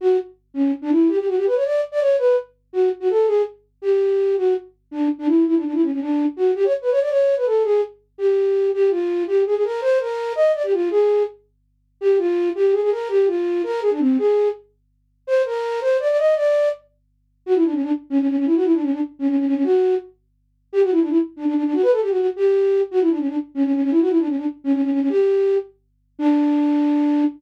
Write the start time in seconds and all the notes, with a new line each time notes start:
0.01 F#4
0.54 C#4
0.82 D4
0.91 E4
1.08 G4
1.18 G4
1.27 F#4
1.36 G4
1.46 B4
1.55 C#5
1.64 D5
1.92 D5
2.01 C#5
2.18 B4
2.73 F#4
3.00 F#4
3.10 A4
3.27 G#4
3.82 G4
4.37 F#4
4.91 D4
5.19 D4
5.28 E4
5.46 E4
5.55 D4
5.64 D4
5.73 E4
5.82 C#4
5.91 C#4
6.00 D4
6.37 F#4
6.55 G4
6.64 C#5
6.82 B4
6.91 C#5
7.01 D5
7.10 C#5
7.36 B4
7.45 A4
7.64 G#4
8.18 G4
8.74 G4
8.90 F4
9.27 G4
9.46 G#4
9.55 G#4
9.64 A#4
9.81 C5
10.00 A#4
10.36 D#5
10.54 D5
10.63 G4
10.73 F4
10.91 G#4
12.01 G4
12.18 F4
12.55 G4
12.72 G#4
12.82 G#4
12.91 A#4
13.09 G4
13.27 F4
13.63 A#4
13.82 G#4
13.91 D4
14.00 C4
14.18 G#4
15.27 C5
15.45 A#4
15.81 C5
16.00 D5
16.09 D5
16.18 D#5
16.36 D5
17.46 F#4
17.55 E4
17.64 D4
17.73 C#4
17.82 D4
18.10 C#4
18.19 C#4
18.28 C#4
18.37 C#4
18.46 E4
18.55 F#4
18.64 E4
18.73 D4
18.82 C#4
18.91 D4
19.19 C#4
19.28 C#4
19.37 C#4
19.46 C#4
19.55 C#4
19.64 F#4
20.73 G4
20.82 F#4
20.91 E4
21.00 D4
21.09 E4
21.36 D4
21.45 D4
21.54 D4
21.64 D4
21.73 F#4
21.82 B4
21.92 A4
22.01 G4
22.10 F#4
22.18 F#4
22.36 G4
22.91 F#4
23.01 E4
23.10 D4
23.19 C#4
23.28 D4
23.55 C#4
23.64 C#4
23.73 C#4
23.82 C#4
23.91 E4
24.00 F#4
24.09 E4
24.18 D4
24.27 C#4
24.37 D4
24.64 C#4
24.73 C#4
24.82 C#4
24.91 C#4
25.00 C#4
25.09 G4
26.19 D4